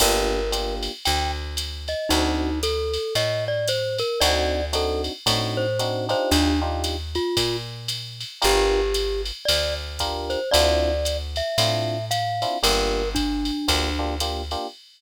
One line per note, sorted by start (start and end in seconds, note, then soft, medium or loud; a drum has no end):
0.00 0.89 G1 loud
0.00 0.39 A#3 medium
0.00 0.39 D4 loud
0.00 0.39 F4 medium
0.00 0.39 G4 medium
0.00 0.75 A#4 loud
0.00 kick soft
0.00 crash medium
0.00 ride medium
0.52 0.91 A#3 medium
0.52 0.91 D4 medium
0.52 0.91 F4 medium
0.52 0.91 G4 medium
0.52 hi-hat pedal medium
0.52 ride medium
0.83 ride medium
1.05 1.95 D2 medium
1.05 1.31 G5 medium
1.05 ride medium
1.57 hi-hat pedal medium
1.57 ride medium
1.88 2.10 D#5 medium
1.88 ride medium
2.09 2.98 D2 loud
2.09 2.50 C4 medium
2.09 2.50 D4 loud
2.09 2.59 D#4 loud
2.09 2.50 D#4 medium
2.09 2.50 F#4 medium
2.09 ride medium
2.63 3.14 A4 loud
2.63 hi-hat pedal medium
2.63 ride medium
2.94 ride medium
3.15 4.03 A2 medium
3.15 3.45 D#5 loud
3.15 ride medium
3.48 3.68 D5 loud
3.68 3.98 C5 loud
3.68 hi-hat pedal medium
3.68 ride medium
3.98 4.20 A#4 loud
3.98 ride medium
4.21 5.09 D2 loud
4.21 4.61 C4 loud
4.21 4.61 D4 medium
4.21 4.61 D#4 medium
4.21 4.61 F#4 loud
4.21 4.65 D5 loud
4.21 ride medium
4.73 5.12 C4 medium
4.73 5.12 D4 medium
4.73 5.12 D#4 medium
4.73 5.12 F#4 medium
4.73 5.02 A4 medium
4.73 hi-hat pedal medium
4.73 ride medium
5.04 ride medium
5.26 6.14 A2 medium
5.26 5.65 C4 medium
5.26 5.65 D4 medium
5.26 5.65 D#4 medium
5.26 5.65 F#4 medium
5.26 kick soft
5.26 ride medium
5.57 6.05 C5 loud
5.79 6.08 C4 medium
5.79 6.08 D4 medium
5.79 6.08 D#4 medium
5.79 6.08 F#4 medium
5.79 hi-hat pedal medium
5.79 ride medium
6.09 6.52 D4 medium
6.09 6.52 D#4 medium
6.09 6.52 F4 medium
6.09 6.52 G4 medium
6.09 6.30 C5 loud
6.09 ride medium
6.31 7.19 D#2 loud
6.31 6.60 D4 loud
6.31 kick soft
6.31 ride medium
6.62 6.96 D4 medium
6.62 6.96 D#4 medium
6.62 6.96 F4 medium
6.62 6.96 G4 medium
6.84 hi-hat pedal medium
6.84 ride medium
7.15 7.57 F4 loud
7.15 ride medium
7.37 8.24 A#2 medium
7.37 kick soft
7.37 ride medium
7.88 hi-hat pedal medium
7.88 ride medium
8.21 ride medium
8.42 9.32 G1 loud
8.42 8.81 D4 medium
8.42 8.81 F4 medium
8.42 8.81 G4 loud
8.42 9.22 G4 loud
8.42 8.81 A#4 medium
8.42 ride medium
8.94 hi-hat pedal medium
8.94 ride medium
9.26 ride medium
9.45 10.36 D2 medium
9.45 9.74 D5 loud
9.45 ride loud
9.99 10.39 D4 medium
9.99 10.39 F4 medium
9.99 10.39 G4 medium
9.99 10.39 A#4 medium
9.99 kick soft
9.99 hi-hat pedal medium
9.99 ride medium
10.30 10.50 C5 medium
10.30 ride medium
10.51 11.42 D2 loud
10.51 10.92 C4 medium
10.51 10.92 D4 loud
10.51 10.92 E4 medium
10.51 10.92 F4 loud
10.51 11.17 D5 loud
10.51 ride medium
11.05 hi-hat pedal medium
11.05 ride medium
11.36 12.05 E5 medium
11.36 ride medium
11.58 12.45 A2 medium
11.58 11.97 C4 medium
11.58 11.97 D4 medium
11.58 11.97 E4 medium
11.58 11.97 F4 medium
11.58 ride medium
12.11 12.58 F5 loud
12.11 hi-hat pedal medium
12.11 ride medium
12.42 12.57 C4 medium
12.42 12.57 D4 medium
12.42 12.57 E4 medium
12.42 12.57 F4 medium
12.42 ride medium
12.63 13.51 G1 loud
12.63 13.02 A#3 medium
12.63 13.02 D4 medium
12.63 13.02 F4 medium
12.63 13.02 G4 medium
12.63 13.09 A#4 loud
12.63 ride medium
13.15 14.16 D4 loud
13.15 kick medium
13.15 hi-hat pedal medium
13.15 ride medium
13.45 ride medium
13.68 14.56 D2 medium
13.68 13.89 A#3 medium
13.68 13.89 D4 medium
13.68 13.89 F4 medium
13.68 13.89 G4 medium
13.68 kick medium
13.68 ride medium
13.99 14.14 A#3 medium
13.99 14.14 D4 medium
13.99 14.14 F4 medium
13.99 14.14 G4 medium
14.20 14.42 A#3 medium
14.20 14.42 D4 medium
14.20 14.42 F4 medium
14.20 14.42 G4 medium
14.20 hi-hat pedal medium
14.20 ride medium
14.51 14.67 A#3 medium
14.51 14.67 D4 medium
14.51 14.67 F4 medium
14.51 14.67 G4 medium
14.51 ride medium